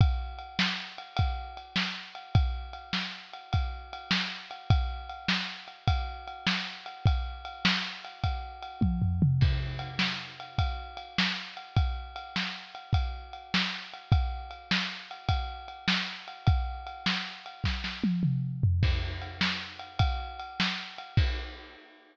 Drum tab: CC |------------|------------|------------|------------|
RD |x-x--xx-x--x|x-x--xx-x--x|x-x--xx-x--x|x-x--xx-x---|
SD |---o-----o--|---o-----o--|---o-----o--|---o--------|
T1 |------------|------------|------------|---------o--|
T2 |------------|------------|------------|-----------o|
FT |------------|------------|------------|----------o-|
BD |o-----o-----|o-----o-----|o-----o-----|o-----o--o--|

CC |x-----------|------------|------------|------------|
RD |--x--xx-x--x|x-x--xx-x--x|x-x--xx-x--x|x-x--x------|
SD |---o-----o--|---o-----o--|---o-----o--|---o--oo----|
T1 |------------|------------|------------|--------o---|
T2 |------------|------------|------------|---------o--|
FT |------------|------------|------------|-----------o|
BD |o-----o-----|o-----o-----|o-----o-----|o-----o-----|

CC |x-----------|x-----------|
RD |--x--xx-x--x|------------|
SD |---o-----o--|------------|
T1 |------------|------------|
T2 |------------|------------|
FT |------------|------------|
BD |o-----o-----|o-----------|